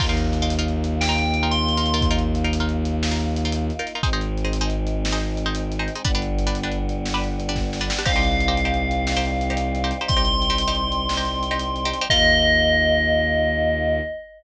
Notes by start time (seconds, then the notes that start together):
0.00 D#2 A#3 D#4 F4 A#4, kick, crash
0.09 D#4 F4 A#4
0.17 closed hi-hat
0.33 closed hi-hat
0.42 D#4 F4 A#4
0.50 closed hi-hat
0.59 D#4 F4 A#4
0.68 closed hi-hat
0.84 closed hi-hat
1.01 G5, snare
1.09 D#4 F4 A#4
1.18 closed hi-hat
1.34 closed hi-hat
1.43 D#4 F4 A#4
1.51 C6, closed hi-hat
1.69 closed hi-hat
1.77 D#4 F4 A#4
1.86 closed hi-hat
1.94 D#4 F4 A#4
2.01 kick, closed hi-hat
2.11 D#4 F4 A#4
2.19 closed hi-hat
2.35 closed hi-hat
2.44 D#4 F4 A#4
2.53 closed hi-hat
2.60 D#4 F4 A#4
2.69 closed hi-hat
2.85 closed hi-hat
3.03 snare
3.11 D#4 F4 A#4
3.19 closed hi-hat
3.36 closed hi-hat
3.45 D#4 F4 A#4
3.52 closed hi-hat
3.70 closed hi-hat
3.79 D#4 F4 A#4
3.87 closed hi-hat
3.95 D#4 F4 A#4
4.03 G#1 G#3 C4 D#4 G#4 C5, kick, closed hi-hat
4.13 D#4 G#4 C5
4.21 closed hi-hat
4.38 closed hi-hat
4.45 D#4 G#4 C5
4.53 closed hi-hat
4.61 D#4 G#4 C5
4.70 closed hi-hat
4.87 closed hi-hat
5.05 snare
5.12 D#4 G#4 C5
5.20 closed hi-hat
5.37 closed hi-hat
5.46 D#4 G#4 C5
5.55 closed hi-hat
5.72 closed hi-hat
5.79 D#4 G#4 C5
5.88 closed hi-hat
5.95 D#4 G#4 C5
6.05 G1 G3 B3 D4 G4 B4, kick, closed hi-hat
6.15 D4 G4 B4
6.22 closed hi-hat
6.39 closed hi-hat
6.47 D4 G4 B4
6.55 closed hi-hat
6.63 D4 G4 B4
6.72 closed hi-hat
6.89 closed hi-hat
7.06 snare
7.14 D4 G4 B4
7.24 closed hi-hat
7.40 closed hi-hat
7.49 D4 G4 B4
7.56 kick, snare
7.73 snare
7.81 D4 G4 B4
7.90 snare
7.99 D4 G4 B4
8.05 C2 G3 C4 D#4 G4 C5 F5, kick, crash
8.16 D#4 G4 C5
8.23 closed hi-hat
8.40 closed hi-hat
8.48 D#4 G4 C5
8.57 closed hi-hat
8.65 D#4 G4 C5
8.74 closed hi-hat
8.91 closed hi-hat
9.07 snare
9.17 D#4 G4 C5
9.25 closed hi-hat
9.41 closed hi-hat
9.50 D#4 G4 C5
9.57 closed hi-hat
9.75 closed hi-hat
9.84 D#4 G4 C5
9.91 closed hi-hat
10.01 D#4 G4 C5
10.07 C2 C6, kick, closed hi-hat
10.17 D#4 G4 C5
10.25 closed hi-hat
10.42 closed hi-hat
10.50 D#4 G4 C5
10.58 closed hi-hat
10.68 D#4 G4 C5
10.75 closed hi-hat
10.92 closed hi-hat
11.09 snare
11.17 D#4 G4 C5
11.25 closed hi-hat
11.43 closed hi-hat
11.51 D#4 G4 C5
11.59 closed hi-hat
11.76 closed hi-hat
11.85 D#4 G4 C5
11.93 closed hi-hat
12.01 D#4 G4 C5
12.09 D#2 A#3 D#4 F4 A#4 D#5, kick, crash